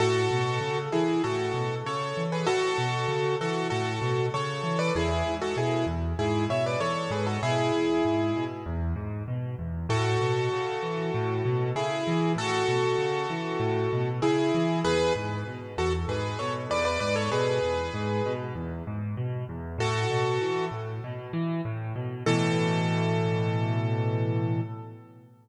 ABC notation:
X:1
M:4/4
L:1/16
Q:1/4=97
K:A
V:1 name="Acoustic Grand Piano"
[FA]6 [EG]2 [FA]4 [Ac]3 [GB] | [FA]6 [FA]2 [FA]4 [Ac]3 [Bd] | [EG]3 [FA] [EG]2 z2 [EG]2 [ce] [Bd] [Ac]2 [GB] [FA] | [EG]8 z8 |
[FA]12 [EG]4 | [FA]12 [EG]4 | [GB]2 z4 [FA] z [GB]2 [Ac] z [Bd] [Bd] [Bd] [Ac] | [GB]8 z8 |
[FA]6 z10 | A16 |]
V:2 name="Acoustic Grand Piano" clef=bass
A,,2 B,,2 C,2 E,2 A,,2 B,,2 C,2 E,2 | A,,2 B,,2 C,2 E,2 A,,2 B,,2 C,2 E,2 | E,,2 G,,2 B,,2 E,,2 G,,2 B,,2 E,,2 G,,2 | B,,2 E,,2 G,,2 B,,2 E,,2 G,,2 B,,2 E,,2 |
A,,2 B,,2 C,2 E,2 A,,2 B,,2 C,2 E,2 | A,,2 B,,2 C,2 E,2 A,,2 B,,2 C,2 E,2 | E,,2 G,,2 B,,2 E,,2 G,,2 B,,2 E,,2 G,,2 | B,,2 E,,2 G,,2 B,,2 E,,2 G,,2 B,,2 E,,2 |
A,,2 B,,2 E,2 A,,2 B,,2 E,2 A,,2 B,,2 | [A,,B,,E,]16 |]